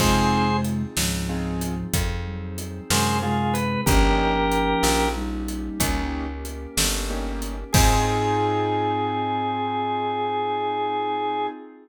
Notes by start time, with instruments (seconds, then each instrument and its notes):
0.00 electric bass (finger) F2, flute C3 G#3, acoustic grand piano C4 D#4 F4 G#4, pad 5 (bowed) C4 D#4 F4 G#4, drawbar organ G#4 C5, kick, crash
0.65 closed hi-hat
0.97 electric bass (finger) C#2, flute G#2 F3, snare
1.29 acoustic grand piano C4 D#4 F4 G#4
1.61 closed hi-hat
1.94 electric bass (finger) F2, pad 5 (bowed) C4 D#4 G#4 C5, kick, closed hi-hat
2.27 flute F#3
2.58 closed hi-hat
2.90 electric bass (finger) F#2, flute C3 G#3, drawbar organ G#4 C5, snare
3.23 flute C3 G#3, drawbar organ F4 G#4
3.54 drawbar organ B4, closed hi-hat
3.86 electric bass (finger) G1, flute F3 C#4, pad 5 (bowed) A#3 C#4 D#4 G4, acoustic grand piano A#3 C#4 D#4 G4, drawbar organ G4 A#4, kick, closed hi-hat
4.52 closed hi-hat
4.83 electric bass (finger) A#1, snare
5.15 flute G3 D#4
5.48 closed hi-hat
5.80 electric bass (finger) C#2, pad 5 (bowed) A#3 C#4 G4 A#4, acoustic grand piano A#3 C#4 D#4 G4, kick, closed hi-hat
6.45 closed hi-hat
6.77 electric bass (finger) G1, snare
7.10 acoustic grand piano A#3 C#4 D#4 G4
7.42 closed hi-hat
7.73 electric bass (finger) G#2, acoustic grand piano C4 D#4 F4 G#4, pad 5 (bowed) C4 D#4 F4 G#4, drawbar organ G#4, flute G#4, kick, crash